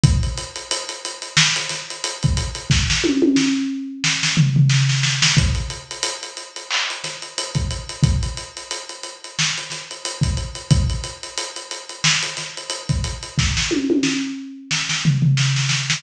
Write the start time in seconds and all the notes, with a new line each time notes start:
0.03 kick, closed hi-hat
0.23 closed hi-hat
0.37 closed hi-hat
0.56 closed hi-hat
0.71 closed hi-hat
0.89 closed hi-hat
1.05 closed hi-hat
1.22 closed hi-hat
1.37 snare
1.56 closed hi-hat
1.69 snare, closed hi-hat
1.90 closed hi-hat
2.04 closed hi-hat
2.23 kick, closed hi-hat
2.37 closed hi-hat
2.55 closed hi-hat
2.70 kick, snare
2.90 snare
3.04 high tom
3.22 high tom
3.36 snare
4.04 snare
4.23 snare
4.37 floor tom
4.56 floor tom
4.69 snare
4.89 snare
5.03 snare
5.22 snare
5.37 kick, closed hi-hat
5.55 closed hi-hat
5.70 closed hi-hat
5.91 closed hi-hat
6.03 closed hi-hat
6.23 closed hi-hat
6.37 closed hi-hat
6.56 closed hi-hat
6.71 clap
6.90 closed hi-hat
7.04 snare, closed hi-hat
7.22 closed hi-hat
7.38 closed hi-hat
7.55 kick, closed hi-hat
7.71 closed hi-hat
7.89 closed hi-hat
8.03 kick, closed hi-hat
8.23 closed hi-hat
8.37 closed hi-hat
8.57 closed hi-hat
8.71 closed hi-hat
8.89 closed hi-hat
9.03 closed hi-hat
9.24 closed hi-hat
9.39 snare
9.58 closed hi-hat
9.70 snare, closed hi-hat
9.91 closed hi-hat
10.05 closed hi-hat
10.21 kick, closed hi-hat
10.37 closed hi-hat
10.55 closed hi-hat
10.70 kick, closed hi-hat
10.90 closed hi-hat
11.04 closed hi-hat
11.23 closed hi-hat
11.38 closed hi-hat
11.56 closed hi-hat
11.71 closed hi-hat
11.89 closed hi-hat
12.04 snare
12.23 closed hi-hat
12.37 snare, closed hi-hat
12.57 closed hi-hat
12.70 closed hi-hat
12.89 kick, closed hi-hat
13.04 closed hi-hat
13.23 closed hi-hat
13.38 kick, snare
13.57 snare
13.71 high tom
13.90 high tom
14.03 snare
14.71 snare
14.89 snare
15.05 floor tom
15.22 floor tom
15.37 snare
15.56 snare
15.69 snare
15.90 snare